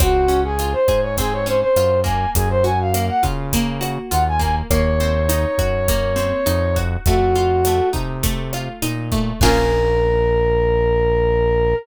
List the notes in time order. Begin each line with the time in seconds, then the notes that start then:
0.00 C#2 C4 F#4, kick, cross-stick, closed hi-hat
0.28 C#4, closed hi-hat
0.45 G#4
0.59 F4, closed hi-hat
0.73 C5
0.88 G#2 G#4, kick, cross-stick, closed hi-hat
1.02 C#5
1.17 C4 G#4, kick, closed hi-hat
1.33 C#5
1.46 C#4 C5, closed hi-hat
1.61 C5
1.76 F#2 F4, cross-stick, closed hi-hat
2.04 A#3 G#5, kick, closed hi-hat
2.35 F#2 G#4, kick, closed hi-hat
2.50 C5
2.64 F#4 G#5, closed hi-hat
2.81 F5
2.94 A#3, cross-stick, closed hi-hat
3.09 F#5
3.23 C#3 F4, kick, closed hi-hat
3.53 A#3, kick, closed hi-hat
3.81 F#4, cross-stick, closed hi-hat
4.10 D#2 F4 F#5, closed hi-hat
4.28 G#5
4.39 A#3 G#5, kick, closed hi-hat
4.70 D#2 A#3 C#5, kick, cross-stick, closed hi-hat
5.00 C4, closed hi-hat
5.29 D#4, closed hi-hat
5.58 F#2 F#4, kick, cross-stick, closed hi-hat
5.88 A#3, kick, closed hi-hat
6.16 C4, closed hi-hat
6.46 F2 D#4, cross-stick, closed hi-hat
6.76 F#4, kick, closed hi-hat
7.05 F2 A3 F#4, kick, closed hi-hat
7.35 F4, closed hi-hat
7.65 A3, cross-stick, closed hi-hat
7.93 C3 D#4, kick, closed hi-hat
8.23 A3, kick, closed hi-hat
8.53 F4, cross-stick, closed hi-hat
8.82 A#2 D#4, closed hi-hat
9.12 A3, kick, closed hi-hat
9.40 A#1 A#3 C#4 F4 G#4 A#4, kick, crash